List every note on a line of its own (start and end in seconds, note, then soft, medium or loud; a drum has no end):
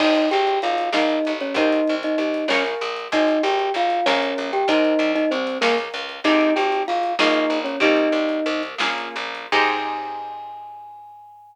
0.00 0.26 G#1 medium
0.00 0.29 D#4 medium
0.00 0.85 C5 medium
0.00 0.29 D#5 loud
0.00 0.85 D#5 medium
0.00 0.85 G5 medium
0.00 0.85 G#5 medium
0.00 kick loud
0.00 crash loud
0.15 closed hi-hat medium
0.31 0.59 G#1 medium
0.31 0.59 G4 medium
0.31 0.59 G5 medium
0.31 closed hi-hat loud
0.47 closed hi-hat medium
0.62 0.90 G#1 medium
0.62 0.90 F4 medium
0.62 0.90 F5 medium
0.62 closed hi-hat loud
0.78 closed hi-hat loud
0.92 1.19 A#1 loud
0.92 1.33 D#4 medium
0.92 1.49 A#4 medium
0.92 1.49 C#5 medium
0.92 1.33 D#5 medium
0.92 1.49 F5 medium
0.92 1.49 G#5 medium
0.92 snare loud
1.09 closed hi-hat medium
1.25 1.53 A1 medium
1.25 closed hi-hat medium
1.40 1.56 C#4 medium
1.40 1.56 C#5 medium
1.40 closed hi-hat medium
1.54 1.81 C2 medium
1.54 1.95 D#4 medium
1.54 2.41 A#4 medium
1.54 2.41 C5 medium
1.54 2.41 D#5 medium
1.54 1.95 D#5 medium
1.54 2.41 G5 medium
1.54 kick loud
1.54 closed hi-hat loud
1.72 closed hi-hat loud
1.87 2.16 C2 medium
1.87 closed hi-hat medium
2.03 2.18 D#4 medium
2.03 2.18 D#5 medium
2.03 closed hi-hat medium
2.18 2.45 C2 medium
2.18 2.47 D#4 medium
2.18 2.47 D#5 medium
2.18 closed hi-hat medium
2.34 closed hi-hat medium
2.48 2.75 A#1 loud
2.48 2.64 C#4 medium
2.48 3.07 A#4 medium
2.48 2.64 C#5 medium
2.48 3.07 C#5 medium
2.48 3.07 F5 medium
2.48 3.07 G#5 medium
2.48 snare loud
2.66 closed hi-hat medium
2.81 3.08 A#1 medium
2.81 closed hi-hat loud
2.96 closed hi-hat medium
3.12 3.39 G#1 medium
3.12 3.42 D#4 medium
3.12 3.97 C5 medium
3.12 3.97 D#5 medium
3.12 3.42 D#5 medium
3.12 3.97 G5 medium
3.12 3.97 G#5 medium
3.12 kick loud
3.12 closed hi-hat loud
3.28 closed hi-hat medium
3.43 3.70 G#1 loud
3.43 3.72 G4 medium
3.43 3.72 G5 medium
3.43 closed hi-hat medium
3.59 closed hi-hat medium
3.74 4.01 G#1 medium
3.74 4.06 F4 medium
3.74 4.06 F5 medium
3.74 closed hi-hat loud
3.90 closed hi-hat medium
4.06 4.34 A#1 loud
4.06 4.51 C#4 medium
4.06 4.62 A#4 medium
4.06 4.51 C#5 medium
4.06 4.62 C#5 medium
4.06 4.62 F5 medium
4.06 4.62 G#5 medium
4.06 snare loud
4.22 closed hi-hat medium
4.38 4.64 A#1 medium
4.38 closed hi-hat medium
4.53 4.68 G4 medium
4.53 4.68 G5 medium
4.53 closed hi-hat medium
4.68 4.94 C2 medium
4.68 5.12 D#4 medium
4.68 5.53 A#4 medium
4.68 5.53 C5 medium
4.68 5.12 D#5 loud
4.68 5.53 D#5 medium
4.68 5.53 G5 medium
4.68 kick loud
4.68 closed hi-hat loud
4.85 closed hi-hat medium
4.99 5.25 C2 medium
4.99 closed hi-hat loud
5.15 5.30 D#4 medium
5.15 5.30 D#5 medium
5.15 closed hi-hat medium
5.31 5.58 C2 medium
5.31 5.58 C4 medium
5.31 5.58 C5 medium
5.31 closed hi-hat medium
5.47 closed hi-hat loud
5.61 5.89 C#2 loud
5.61 5.76 A#3 medium
5.61 5.76 A#4 medium
5.61 6.18 A#4 medium
5.61 6.18 C#5 medium
5.61 6.18 F5 medium
5.61 6.18 G#5 medium
5.61 snare loud
5.78 closed hi-hat medium
5.94 6.20 C#2 medium
5.94 closed hi-hat loud
6.09 closed hi-hat medium
6.24 6.51 G#1 loud
6.24 7.09 C4 medium
6.24 7.09 D#4 medium
6.24 6.53 D#4 medium
6.24 7.09 G4 medium
6.24 7.09 G#4 medium
6.24 6.53 D#5 loud
6.24 kick loud
6.24 closed hi-hat loud
6.41 closed hi-hat medium
6.56 6.83 G#1 medium
6.56 6.83 G4 medium
6.56 6.83 G5 medium
6.56 closed hi-hat medium
6.72 closed hi-hat medium
6.88 7.15 G#1 medium
6.88 7.14 F4 medium
6.88 7.14 F5 medium
6.88 closed hi-hat loud
7.03 closed hi-hat medium
7.19 7.46 A#1 loud
7.19 7.75 A#3 medium
7.19 7.75 C#4 medium
7.19 7.59 D#4 medium
7.19 7.75 F4 medium
7.19 7.75 G#4 medium
7.19 7.59 D#5 medium
7.19 snare loud
7.34 closed hi-hat medium
7.50 7.76 A#1 medium
7.50 closed hi-hat medium
7.64 7.79 C#4 medium
7.64 7.79 C#5 medium
7.64 closed hi-hat medium
7.80 8.08 C2 loud
7.80 8.69 A#3 medium
7.80 8.69 C4 medium
7.80 8.69 D#4 medium
7.80 8.62 D#4 medium
7.80 8.69 G4 medium
7.80 8.62 D#5 medium
7.80 kick loud
7.80 closed hi-hat loud
7.97 closed hi-hat medium
8.12 8.40 C2 medium
8.12 closed hi-hat medium
8.29 closed hi-hat medium
8.46 8.75 C2 loud
8.46 closed hi-hat medium
8.63 closed hi-hat medium
8.78 9.09 A#1 loud
8.78 9.46 A#3 medium
8.78 9.46 C#4 medium
8.78 9.46 F4 medium
8.78 9.46 G#4 medium
8.78 snare loud
8.98 closed hi-hat medium
9.16 9.47 A#1 medium
9.16 closed hi-hat medium
9.35 closed hi-hat medium
9.52 11.55 G#2 loud
9.52 11.55 C4 loud
9.52 11.55 D#4 loud
9.52 11.55 G4 loud
9.52 11.55 G#4 medium
9.52 11.55 G#5 loud
9.52 kick loud
9.52 crash loud